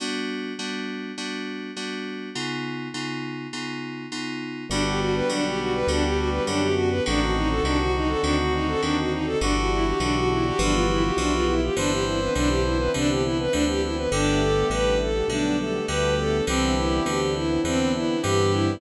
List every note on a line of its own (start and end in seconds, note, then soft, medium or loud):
0.00 0.53 G3 medium
0.00 0.53 B3 medium
0.00 0.53 D4 medium
0.00 0.53 F#4 medium
0.59 1.12 G3 medium
0.59 1.12 B3 medium
0.59 1.12 D4 medium
0.59 1.12 F#4 medium
1.18 1.71 G3 medium
1.18 1.71 B3 medium
1.18 1.71 D4 medium
1.18 1.71 F#4 medium
1.76 2.29 G3 medium
1.76 2.29 B3 medium
1.76 2.29 D4 medium
1.76 2.29 F#4 medium
2.35 2.88 C#3 medium
2.35 2.88 B3 medium
2.35 2.88 D#4 medium
2.35 2.88 F4 medium
2.94 3.47 C#3 medium
2.94 3.47 B3 medium
2.94 3.47 D#4 medium
2.94 3.47 F4 medium
3.53 4.06 C#3 medium
3.53 4.06 B3 medium
3.53 4.06 D#4 medium
3.53 4.06 F4 medium
4.12 4.65 C#3 soft
4.12 4.65 B3 medium
4.12 4.65 D#4 medium
4.12 4.65 F4 medium
4.69 5.22 G1 loud
4.69 5.24 D3 medium
4.69 6.67 G3 loud
4.69 5.24 B3 medium
4.69 7.03 B3 medium
4.69 4.82 D4 medium
4.69 7.03 D4 medium
4.69 5.24 F#4 medium
4.69 7.03 F#4 medium
4.69 5.24 G4 medium
4.69 7.03 G4 medium
4.86 5.00 G4 medium
5.00 5.13 F#4 medium
5.15 5.28 B4 medium
5.29 5.84 B1 medium
5.29 5.82 D3 medium
5.29 5.82 B3 medium
5.29 5.44 D4 medium
5.29 5.82 F#4 medium
5.29 5.82 G4 medium
5.46 5.59 G4 medium
5.59 5.72 F#4 medium
5.74 5.88 B4 medium
5.87 6.40 D2 medium
5.87 6.41 D3 medium
5.87 6.41 B3 medium
5.87 6.04 D4 medium
5.87 6.41 F#4 medium
5.87 6.41 G4 medium
6.03 6.17 G4 medium
6.16 6.30 F#4 medium
6.30 6.44 B4 medium
6.47 7.01 F#2 loud
6.47 7.00 D3 medium
6.47 7.00 B3 medium
6.47 6.61 D4 medium
6.47 7.00 F#4 medium
6.47 7.00 G4 medium
6.60 6.74 G4 medium
6.75 6.89 F#4 medium
6.90 7.03 B4 medium
7.06 7.61 A1 medium
7.06 7.59 D3 medium
7.06 7.59 D#3 medium
7.06 7.59 C4 medium
7.06 9.39 C4 medium
7.06 9.39 D4 medium
7.06 7.21 D4 medium
7.06 9.39 D#4 medium
7.06 7.59 F#4 medium
7.06 8.99 F#4 loud
7.06 9.39 F#4 medium
7.21 7.34 F#4 medium
7.35 7.49 D#4 medium
7.49 7.63 A4 medium
7.63 8.16 C2 medium
7.63 8.18 D3 medium
7.63 8.18 D#3 medium
7.63 8.18 C4 medium
7.63 7.78 D4 medium
7.63 8.18 F#4 medium
7.79 7.93 F#4 medium
7.95 8.09 D#4 medium
8.08 8.21 A4 medium
8.21 8.76 D2 medium
8.21 8.76 D3 medium
8.21 8.76 D#3 medium
8.21 8.76 C4 medium
8.21 8.35 D4 medium
8.21 8.76 F#4 medium
8.40 8.53 F#4 medium
8.54 8.67 D#4 medium
8.68 8.81 A4 medium
8.82 9.36 D#2 medium
8.82 9.35 D3 medium
8.82 9.35 D#3 medium
8.82 9.35 C4 medium
8.82 8.95 D4 medium
8.82 9.35 F#4 medium
8.98 9.12 F#4 medium
9.12 9.25 D#4 medium
9.25 9.39 A4 medium
9.40 9.94 G1 loud
9.40 9.94 D3 medium
9.40 9.94 E3 medium
9.40 9.54 D4 medium
9.40 10.58 D4 medium
9.40 10.58 E4 medium
9.40 9.94 F#4 medium
9.40 10.58 F#4 medium
9.40 11.54 F#4 loud
9.40 9.94 G4 medium
9.40 10.58 G4 medium
9.56 9.70 F#4 medium
9.71 9.85 E4 medium
9.85 9.99 G4 medium
10.00 10.53 B1 loud
10.00 10.53 D3 medium
10.00 10.53 E3 medium
10.00 10.14 D4 medium
10.00 10.53 F#4 medium
10.00 10.53 G4 medium
10.15 10.29 F#4 medium
10.31 10.45 E4 medium
10.46 10.59 G4 medium
10.59 11.12 G1 loud
10.59 11.12 E3 medium
10.59 11.12 F3 medium
10.59 11.75 B3 medium
10.59 10.73 D4 medium
10.59 11.75 E4 medium
10.59 11.75 F4 medium
10.59 11.75 G4 medium
10.59 11.12 G4 medium
10.59 11.12 B4 medium
10.71 10.85 F4 medium
10.90 11.03 E4 medium
11.04 11.17 G4 medium
11.17 11.70 B1 medium
11.17 11.71 E3 medium
11.17 11.71 F3 medium
11.17 11.32 D4 medium
11.17 11.71 G4 medium
11.17 11.71 B4 medium
11.32 11.46 F4 medium
11.47 11.61 E4 medium
11.62 11.76 G4 medium
11.76 12.29 G1 loud
11.76 12.29 D3 medium
11.76 12.29 E3 medium
11.76 14.09 B3 medium
11.76 14.09 C4 medium
11.76 14.09 D4 medium
11.76 11.91 D4 medium
11.76 14.09 E4 medium
11.76 12.29 B4 medium
11.76 12.29 C5 medium
11.76 12.91 C5 loud
11.90 12.04 G4 medium
12.06 12.19 E4 medium
12.20 12.33 B4 medium
12.35 12.89 B1 medium
12.35 12.88 D3 medium
12.35 12.88 E3 medium
12.35 12.49 D4 medium
12.35 12.88 B4 medium
12.35 12.88 C5 medium
12.48 12.61 G4 medium
12.64 12.77 E4 medium
12.78 12.92 B4 medium
12.94 13.48 C2 medium
12.94 13.47 D3 medium
12.94 13.47 E3 medium
12.94 13.09 D4 medium
12.94 13.47 B4 medium
12.94 13.47 C5 medium
13.09 13.23 G4 medium
13.24 13.37 E4 medium
13.39 13.53 B4 medium
13.51 14.07 D2 medium
13.51 14.06 D3 medium
13.51 14.06 E3 medium
13.51 13.64 D4 medium
13.51 14.06 B4 medium
13.51 14.06 C5 medium
13.68 13.81 G4 medium
13.82 13.96 E4 medium
13.96 14.10 B4 medium
14.11 14.64 G1 loud
14.11 14.65 D3 medium
14.11 14.65 G3 medium
14.11 16.45 A3 medium
14.11 16.45 B3 medium
14.11 16.45 D4 medium
14.11 14.41 D4 medium
14.11 16.45 G4 medium
14.11 14.94 G4 loud
14.11 14.65 A4 medium
14.11 14.65 B4 medium
14.40 14.67 A4 medium
14.70 15.23 A1 medium
14.70 15.24 D3 medium
14.70 15.24 G3 medium
14.70 15.24 A4 medium
14.70 15.24 B4 medium
14.70 14.98 B4 medium
15.01 15.28 A4 medium
15.28 15.81 B1 medium
15.28 15.82 D3 medium
15.28 15.82 G3 medium
15.28 15.56 D4 medium
15.28 15.82 A4 medium
15.28 15.82 B4 medium
15.59 15.86 A4 medium
15.88 16.42 D2 medium
15.88 16.41 D3 medium
15.88 16.41 G3 medium
15.88 16.37 G4 loud
15.88 16.41 A4 medium
15.88 16.15 B4 medium
15.88 16.41 B4 medium
16.18 16.44 A4 medium
16.47 17.01 C2 medium
16.47 17.00 D3 medium
16.47 17.00 E3 medium
16.47 18.80 B3 medium
16.47 16.74 C4 medium
16.47 18.80 C4 medium
16.47 18.80 D4 medium
16.47 18.80 E4 medium
16.47 17.20 G4 loud
16.47 17.00 B4 medium
16.47 17.00 C5 medium
16.76 17.03 E4 medium
17.06 17.59 D2 medium
17.06 17.59 D3 medium
17.06 17.59 E3 medium
17.06 17.33 G4 medium
17.06 17.59 B4 medium
17.06 17.59 C5 medium
17.34 17.61 E4 medium
17.64 18.17 E2 medium
17.64 18.18 D3 medium
17.64 18.18 E3 medium
17.64 17.91 C4 medium
17.64 18.18 B4 medium
17.64 18.18 C5 medium
17.94 18.21 E4 medium
18.23 18.77 G2 medium
18.23 18.76 D3 medium
18.23 18.76 E3 medium
18.23 18.74 G4 loud
18.23 18.52 G4 medium
18.23 18.76 B4 medium
18.23 18.76 C5 medium
18.51 18.79 E4 medium